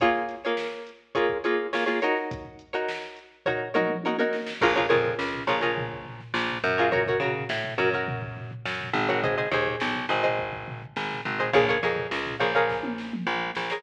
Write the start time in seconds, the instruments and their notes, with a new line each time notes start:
0.00 pizzicato strings A#3 F4 G#4 C#5, kick, closed hi-hat
0.15 snare
0.29 snare, closed hi-hat
0.44 pizzicato strings A#3 F4 G#4 C#5, snare
0.57 snare
0.87 closed hi-hat
1.15 pizzicato strings A#3 F4 G#4 C#5, kick, closed hi-hat
1.29 kick
1.44 pizzicato strings A#3 F4 G#4 C#5, closed hi-hat
1.73 pizzicato strings A#3 F4 G#4 C#5, snare
1.86 pizzicato strings A#3 F4 G#4 C#5, snare
2.02 pizzicato strings D#4 F#4 A#4 C#5, closed hi-hat
2.16 snare
2.31 kick, closed hi-hat
2.45 kick
2.59 closed hi-hat
2.73 pizzicato strings D#4 F#4 A#4 C#5
2.88 snare
3.16 closed hi-hat
3.46 pizzicato strings D#4 F#4 A#4 C#5, kick, floor tom
3.74 pizzicato strings D#4 F#4 A#4 C#5, mid tom
3.89 mid tom
4.03 pizzicato strings D#4 F#4 A#4 C#5, high tom
4.18 pizzicato strings D#4 F#4 A#4 C#5, high tom
4.33 snare
4.47 snare
4.61 electric bass (finger) A#1, pizzicato strings F4 G#4 A#4 C#5, kick, crash
4.76 pizzicato strings F4 G#4 A#4 C#5, kick, floor tom
4.89 electric bass (finger) F2, pizzicato strings F4 G#4 A#4 C#5, floor tom
5.05 floor tom
5.19 electric bass (finger) C#2, snare
5.34 floor tom
5.47 electric bass (finger) A#1, pizzicato strings F4 G#4 A#4 C#5, floor tom
5.61 pizzicato strings F4 G#4 A#4 C#5, snare, floor tom
5.77 kick, floor tom
5.91 kick, floor tom
6.05 floor tom
6.20 snare, floor tom
6.34 electric bass (finger) A#1, snare
6.49 snare, floor tom
6.64 electric bass (finger) F#2, floor tom
6.78 pizzicato strings F4 G#4 A#4 C#5, snare, floor tom
6.92 pizzicato strings F#4 A#4 C#5, kick, floor tom
7.06 pizzicato strings F#4 A#4 C#5, kick, floor tom
7.20 electric bass (finger) C#3, pizzicato strings F#4 A#4 C#5, floor tom
7.35 floor tom
7.49 electric bass (finger) A2, snare
7.64 floor tom
7.78 electric bass (finger) F#2, pizzicato strings F#4 A#4 C#5, floor tom
7.93 pizzicato strings F#4 A#4 C#5, floor tom
8.07 kick, floor tom
8.22 kick, floor tom
8.37 floor tom
8.51 floor tom
8.66 electric bass (finger) F#2, snare
8.79 snare, floor tom
8.94 electric bass (finger) G#1, floor tom
9.09 pizzicato strings F#4 A#4 C#5, snare, floor tom
9.23 pizzicato strings G#4 C5 D#5, kick, floor tom
9.37 pizzicato strings G#4 C5 D#5, snare, floor tom
9.51 electric bass (finger) D#2, pizzicato strings G#4 C5 D#5, snare, floor tom
9.66 floor tom
9.80 electric bass (finger) B1, snare
9.95 floor tom
10.09 electric bass (finger) G#1, pizzicato strings G#4 C5 D#5, floor tom
10.23 pizzicato strings G#4 C5 D#5, floor tom
10.39 kick
10.52 kick, floor tom
10.68 floor tom
10.82 floor tom
10.96 electric bass (finger) G#1, snare
11.10 snare, floor tom
11.25 electric bass (finger) G#1, floor tom
11.39 pizzicato strings G#4 C5 D#5, snare, floor tom
11.53 electric bass (finger) A#1, pizzicato strings G#4 A#4 C#5 F5, kick, floor tom
11.68 pizzicato strings G#4 A#4 C#5 F5, kick, floor tom
11.82 electric bass (finger) F2, pizzicato strings G#4 A#4 C#5 F5, floor tom
11.97 floor tom
12.11 electric bass (finger) C#2, snare
12.26 floor tom
12.40 electric bass (finger) A#1, pizzicato strings G#4 A#4 C#5 F5, floor tom
12.55 pizzicato strings G#4 A#4 C#5 F5, floor tom
12.69 kick, snare
12.83 high tom
12.98 snare
13.13 mid tom
13.27 electric bass (finger) A#1
13.55 electric bass (finger) A#1, snare
13.70 pizzicato strings G#4 A#4 C#5 F5, snare